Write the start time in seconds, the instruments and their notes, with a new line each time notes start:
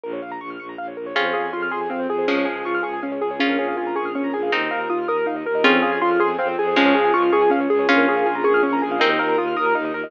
0.04 violin A#1, acoustic grand piano A#4
0.13 acoustic grand piano C#5
0.22 violin A#1, acoustic grand piano F5
0.32 acoustic grand piano A#5
0.40 violin A#1, acoustic grand piano C#6
0.50 acoustic grand piano F6
0.59 violin A#1, acoustic grand piano C#6
0.69 acoustic grand piano A#5
0.78 violin A#1, acoustic grand piano F5
0.88 acoustic grand piano C#5
0.96 violin A#1, acoustic grand piano A#4
1.06 acoustic grand piano C#5
1.15 violin F2, acoustic grand piano C4 G#4, pad 5 (bowed) C4 F4 G#4, pizzicato strings C#4 F4
1.25 acoustic grand piano C5
1.33 violin F2, acoustic grand piano G#4 F5
1.44 acoustic grand piano G#5
1.53 violin F2, acoustic grand piano F4 C6
1.62 acoustic grand piano F6
1.71 violin F2, acoustic grand piano G#4 C6
1.81 acoustic grand piano G#5
1.90 violin F2, acoustic grand piano C4 F5
2.00 acoustic grand piano C5
2.09 violin F2, acoustic grand piano G#4
2.18 acoustic grand piano C5
2.28 violin C#2, pizzicato strings F3 G#3, pad 5 (bowed) C#4 F4 G#4, acoustic grand piano C#4 G#4
2.37 acoustic grand piano C#5
2.45 violin C#2, acoustic grand piano G#4 F5
2.56 acoustic grand piano G#5
2.65 violin C#2, acoustic grand piano F4 C#6
2.75 acoustic grand piano F6
2.83 violin C#2, acoustic grand piano G#4 C#6
2.93 acoustic grand piano G#5
3.02 violin C#2, acoustic grand piano C#4 F5
3.12 acoustic grand piano C#5
3.21 violin C#2, acoustic grand piano G#4
3.31 acoustic grand piano C#5
3.39 violin A#1, pad 5 (bowed) C#4 F4 G#4 A#4, acoustic grand piano C#4 G#4, pizzicato strings C#4 F4
3.49 acoustic grand piano A#4
3.59 violin A#1, acoustic grand piano G#4 C#5
3.68 acoustic grand piano F5
3.77 violin A#1, acoustic grand piano F4 G#5
3.87 acoustic grand piano A#5
3.96 violin A#1, acoustic grand piano G#4 C#6
4.05 acoustic grand piano F6
4.15 violin A#1, acoustic grand piano C#4 C#6
4.24 acoustic grand piano A#5
4.33 violin A#1, acoustic grand piano G#4 G#5
4.43 acoustic grand piano F5
4.52 violin D#2, pizzicato strings C4 D#4, acoustic grand piano D#4 A#4, pad 5 (bowed) D#4 F4 A#4
4.61 acoustic grand piano D#5
4.71 violin D#2, acoustic grand piano A#4 F5
4.80 acoustic grand piano A#5
4.89 violin D#2, acoustic grand piano F4 D#6
4.99 acoustic grand piano F6
5.08 violin D#2, acoustic grand piano A#4 D#6
5.18 acoustic grand piano A#5
5.26 violin D#2, acoustic grand piano D#4 F5
5.36 acoustic grand piano D#5
5.46 violin D#2, acoustic grand piano A#4
5.55 acoustic grand piano D#5
5.64 violin F2, acoustic grand piano C4 G#4, pad 5 (bowed) C4 F4 G#4, pizzicato strings C#4 F4
5.74 acoustic grand piano C5
5.82 violin F2, acoustic grand piano G#4 F5
5.92 acoustic grand piano G#5
6.01 violin F2, acoustic grand piano F4 C6
6.11 acoustic grand piano F6
6.20 violin F2, acoustic grand piano G#4 C6
6.30 acoustic grand piano G#5
6.39 violin F2, acoustic grand piano C4 F5
6.48 acoustic grand piano C5
6.58 violin F2, acoustic grand piano G#4
6.67 acoustic grand piano C5
6.76 violin C#2, pizzicato strings F3 G#3, pad 5 (bowed) C#4 F4 G#4, acoustic grand piano C#4 G#4
6.86 acoustic grand piano C#5
6.95 violin C#2, acoustic grand piano G#4 F5
7.05 acoustic grand piano G#5
7.14 violin C#2, acoustic grand piano F4 C#6
7.23 acoustic grand piano F6
7.32 violin C#2, acoustic grand piano G#4 C#6
7.42 acoustic grand piano G#5
7.50 violin C#2, acoustic grand piano C#4 F5
7.61 acoustic grand piano C#5
7.69 violin C#2, acoustic grand piano G#4
7.79 acoustic grand piano C#5
7.89 violin A#1, pad 5 (bowed) C#4 F4 G#4 A#4, pizzicato strings C#4 F4, acoustic grand piano C#4 G#4
7.98 acoustic grand piano A#4
8.07 violin A#1, acoustic grand piano G#4 C#5
8.17 acoustic grand piano F5
8.26 violin A#1, acoustic grand piano F4 G#5
8.35 acoustic grand piano A#5
8.44 violin A#1, acoustic grand piano G#4 C#6
8.54 acoustic grand piano F6
8.63 violin A#1, acoustic grand piano C#4 C#6
8.73 acoustic grand piano A#5
8.82 violin A#1, acoustic grand piano G#4 G#5
8.91 acoustic grand piano F5
9.00 violin D#2, pizzicato strings C4 D#4, acoustic grand piano D#4 A#4, pad 5 (bowed) D#4 F4 A#4
9.10 acoustic grand piano D#5
9.19 violin D#2, acoustic grand piano A#4 F5
9.29 acoustic grand piano A#5
9.38 violin D#2, acoustic grand piano F4 D#6
9.48 acoustic grand piano F6
9.56 violin D#2, acoustic grand piano A#4 D#6
9.66 acoustic grand piano A#5
9.75 violin D#2, acoustic grand piano D#4 F5
9.85 acoustic grand piano D#5
9.94 violin D#2, acoustic grand piano A#4
10.04 acoustic grand piano D#5